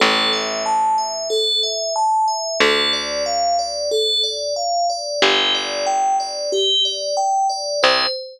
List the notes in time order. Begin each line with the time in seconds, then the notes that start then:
0.00 A1 A4
0.33 E5
0.66 A5
0.98 E5
1.30 A4
1.63 E5
1.96 A5
2.28 E5
2.60 D2 A4
2.93 D5
3.26 F5
3.59 D5
3.91 A4
4.24 D5
4.56 F5
4.90 D5
5.22 G1 G4
5.54 D5
5.86 G5
6.20 D5
6.52 G4
6.85 D5
7.17 G5
7.49 D5
7.83 C2 C5